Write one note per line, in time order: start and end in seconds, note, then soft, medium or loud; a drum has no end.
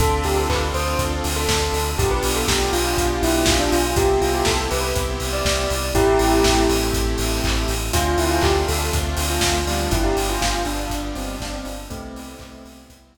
0.00 0.21 D2 medium
0.00 1.96 C4 medium
0.00 1.79 C4 medium
0.00 1.96 D4 medium
0.00 1.79 D4 medium
0.00 1.96 F4 medium
0.00 1.79 F4 medium
0.00 0.22 A4 loud
0.00 1.96 A4 medium
0.00 1.79 A4 medium
0.00 kick loud
0.00 closed hi-hat loud
0.24 0.46 D2 medium
0.24 0.37 G4 medium
0.24 open hi-hat medium
0.37 0.49 A4 medium
0.49 0.70 D2 medium
0.49 0.61 B4 medium
0.49 kick medium
0.49 clap loud
0.74 0.95 D2 medium
0.74 0.97 C5 medium
0.74 open hi-hat medium
0.99 1.20 D2 medium
0.99 kick medium
0.99 closed hi-hat medium
1.24 1.46 D2 medium
1.24 open hi-hat medium
1.36 1.89 A4 medium
1.48 1.69 D2 medium
1.48 kick medium
1.48 snare loud
1.73 1.94 D2 medium
1.73 open hi-hat medium
1.98 2.19 B1 medium
1.98 3.76 B3 medium
1.98 3.95 B3 medium
1.98 3.76 D4 medium
1.98 3.95 D4 medium
1.98 3.76 F4 medium
1.98 3.95 F4 medium
1.98 3.76 G4 medium
1.98 2.10 G4 loud
1.98 3.95 G4 medium
1.98 kick loud
1.98 closed hi-hat loud
2.11 2.23 B4 medium
2.23 2.44 B1 medium
2.23 open hi-hat medium
2.36 2.47 A4 medium
2.48 2.69 B1 medium
2.48 2.69 G4 medium
2.48 kick medium
2.48 snare loud
2.73 2.94 B1 medium
2.73 3.18 F4 medium
2.73 open hi-hat medium
2.97 3.18 B1 medium
2.97 kick medium
2.97 closed hi-hat loud
3.22 3.43 B1 medium
3.22 3.43 E4 loud
3.22 open hi-hat medium
3.46 3.67 B1 medium
3.46 3.59 F4 medium
3.46 kick loud
3.46 snare loud
3.60 3.71 D4 loud
3.72 3.93 B1 medium
3.72 3.95 F4 medium
3.72 open hi-hat medium
3.96 4.17 C2 medium
3.96 5.75 B3 medium
3.96 5.93 B3 medium
3.96 5.75 C4 medium
3.96 5.93 C4 medium
3.96 5.75 E4 medium
3.96 5.93 E4 medium
3.96 4.17 G4 loud
3.96 5.75 G4 medium
3.96 5.93 G4 medium
3.96 kick loud
3.96 closed hi-hat loud
4.21 4.42 C2 medium
4.21 4.33 F4 medium
4.21 open hi-hat medium
4.34 4.46 G4 medium
4.45 4.67 C2 medium
4.45 4.58 A4 medium
4.45 kick medium
4.45 snare loud
4.71 4.93 C2 medium
4.71 4.92 B4 medium
4.71 open hi-hat medium
4.95 5.17 C2 medium
4.95 kick medium
4.95 closed hi-hat medium
5.20 5.41 C2 medium
5.20 open hi-hat medium
5.33 5.89 D5 medium
5.45 5.66 C2 medium
5.45 kick medium
5.45 snare loud
5.70 5.92 C2 medium
5.70 open hi-hat medium
5.94 6.15 A1 medium
5.94 7.74 A3 medium
5.94 7.92 A3 medium
5.94 7.74 C4 medium
5.94 7.92 C4 medium
5.94 6.60 E4 loud
5.94 7.74 E4 medium
5.94 7.92 E4 medium
5.94 6.60 G4 loud
5.94 7.74 G4 medium
5.94 7.92 G4 medium
5.94 kick loud
5.94 closed hi-hat medium
6.19 6.41 A1 medium
6.19 open hi-hat medium
6.44 6.66 A1 medium
6.44 kick medium
6.44 snare loud
6.69 6.91 A1 medium
6.69 open hi-hat medium
6.93 7.15 A1 medium
6.93 kick medium
6.93 closed hi-hat loud
7.18 7.40 A1 medium
7.18 open hi-hat medium
7.44 7.65 A1 medium
7.44 kick medium
7.44 clap loud
7.68 7.90 A1 medium
7.68 open hi-hat medium
7.93 8.15 D2 medium
7.93 9.58 A3 medium
7.93 9.90 A3 medium
7.93 9.58 C4 medium
7.93 9.90 C4 medium
7.93 9.58 D4 medium
7.93 9.90 D4 medium
7.93 8.15 F4 loud
7.93 9.58 F4 medium
7.93 9.90 F4 medium
7.93 kick medium
7.93 closed hi-hat loud
8.18 8.39 D2 medium
8.18 8.30 E4 loud
8.18 open hi-hat medium
8.31 8.42 F4 loud
8.42 8.63 D2 medium
8.42 8.55 G4 medium
8.42 kick loud
8.42 clap loud
8.68 8.90 D2 medium
8.68 8.89 A4 medium
8.68 open hi-hat medium
8.93 9.14 D2 medium
8.93 kick medium
8.93 closed hi-hat loud
9.17 9.39 D2 medium
9.17 open hi-hat medium
9.30 9.81 F4 medium
9.41 9.63 D2 medium
9.41 kick medium
9.41 snare loud
9.66 9.87 D2 medium
9.66 11.70 G3 medium
9.66 11.70 B3 medium
9.66 11.70 D4 medium
9.66 11.70 F4 medium
9.66 open hi-hat medium
9.91 10.13 G1 medium
9.91 11.88 G3 medium
9.91 11.88 B3 medium
9.91 11.88 D4 medium
9.91 10.04 E4 medium
9.91 11.88 F4 medium
9.91 kick loud
9.91 closed hi-hat loud
10.04 10.16 G4 medium
10.17 10.38 G1 medium
10.17 open hi-hat medium
10.29 10.41 F4 loud
10.41 10.63 G1 medium
10.41 10.63 F4 loud
10.41 kick medium
10.41 snare loud
10.65 10.87 G1 medium
10.65 11.09 D4 loud
10.65 open hi-hat medium
10.90 11.11 G1 medium
10.90 kick medium
10.90 closed hi-hat loud
11.15 11.37 G1 medium
11.15 11.40 C4 medium
11.15 open hi-hat medium
11.40 11.62 G1 medium
11.40 11.52 D4 loud
11.40 kick medium
11.40 snare loud
11.53 11.65 C4 loud
11.65 11.87 G1 medium
11.65 11.85 D4 medium
11.65 open hi-hat medium
11.90 12.12 C2 medium
11.90 13.17 G3 medium
11.90 12.79 A3 loud
11.90 13.17 B3 medium
11.90 13.17 C4 medium
11.90 12.79 C4 loud
11.90 13.17 E4 medium
11.90 kick loud
11.90 closed hi-hat loud
12.14 12.36 C2 medium
12.14 open hi-hat medium
12.39 12.61 C2 medium
12.39 kick medium
12.39 clap medium
12.65 12.86 C2 medium
12.65 open hi-hat medium
12.88 13.11 C2 medium
12.88 kick medium
12.88 closed hi-hat loud
13.14 13.17 C2 medium
13.14 open hi-hat medium